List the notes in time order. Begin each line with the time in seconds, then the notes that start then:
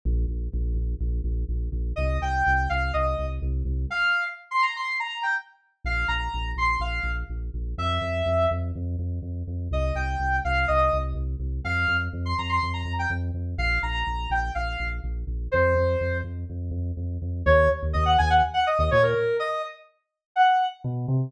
0.05 A#1
0.28 A#1
0.53 A#1
0.74 A#1
1.00 A#1
1.24 A#1
1.49 A#1
1.72 A#1
1.96 C2 D#5
2.21 C2 G5
2.47 C2
2.69 C2 F5
2.93 C2 D#5
3.19 C2
3.42 C2
3.65 C2
3.90 F5
4.51 C6
4.62 A#5
4.76 C6
4.99 A#5
5.23 G5
5.84 A#1 F5
6.08 A#1 A#5
6.34 A#1
6.56 A#1 C6
6.80 A#1 F5
7.03 A#1
7.30 A#1
7.54 A#1
7.78 F2 E5
8.01 F2
8.26 F2
8.51 F2
8.75 F2
8.99 F2
9.22 F2
9.47 F2
9.71 C2 D#5
9.95 C2 G5
10.19 C2
10.44 C2 F5
10.68 C2 D#5
10.93 C2
11.15 C2
11.40 C2
11.65 F2 F5
11.88 F2
12.13 F2
12.25 C6
12.38 F2 A#5
12.49 C6
12.63 F2
12.73 A#5
12.85 F2
12.99 G5
13.10 F2
13.34 F2
13.58 A#1 F5
13.83 A#1 A#5
14.07 A#1
14.30 A#1 G5
14.55 A#1 F5
14.80 A#1
15.04 A#1
15.27 A#1
15.51 F2 C5
15.75 F2
16.01 F2
16.24 F2
16.49 F2
16.71 F2
16.97 F2
17.22 F2
17.46 D#2 C#5
17.83 D#2
17.93 D#2 D#5
18.05 F#5
18.18 D#2 G#5
18.30 F#5
18.54 F#5
18.66 D#5
18.79 D#2 D#5
18.91 A#2 C#5
19.03 A#4
19.39 D#5
20.36 F#5
20.84 B2
21.08 C3